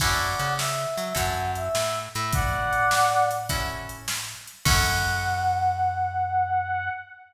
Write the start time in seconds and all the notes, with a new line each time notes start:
0.00 F#2 C#4 E4 F#4 A4 D5 F#5, kick, crash
0.39 C#3, closed hi-hat
0.58 E5, snare
0.97 F#3, closed hi-hat
1.15 F#2 C#4 E4 F#4 A4 F#5, kick, closed hi-hat
1.55 E5, closed hi-hat
1.75 A2, snare
2.14 A2 E5, closed hi-hat
2.33 D5 F#5, kick, closed hi-hat
2.73 closed hi-hat
2.91 snare
3.31 closed hi-hat
3.49 C#4 E4 F#4 A4, kick, closed hi-hat
3.89 closed hi-hat
4.08 snare
4.47 closed hi-hat
4.65 F#2 C#4 E4 F#4 A4 F#5, kick, crash